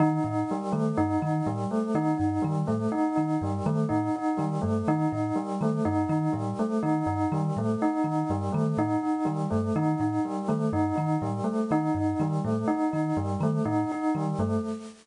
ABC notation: X:1
M:3/4
L:1/8
Q:1/4=123
K:none
V:1 name="Kalimba" clef=bass
_E, A,, z E, G,, E, | A,, z _E, G,, E, A,, | z _E, G,, E, A,, z | _E, G,, E, A,, z E, |
G,, _E, A,, z E, G,, | _E, A,, z E, G,, E, | A,, z _E, G,, E, A,, | z _E, G,, E, A,, z |
_E, G,, E, A,, z E, | G,, _E, A,, z E, G,, |]
V:2 name="Tubular Bells"
_E E G, A, E E | G, A, _E E G, A, | _E E G, A, E E | G, A, _E E G, A, |
_E E G, A, E E | G, A, _E E G, A, | _E E G, A, E E | G, A, _E E G, A, |
_E E G, A, E E | G, A, _E E G, A, |]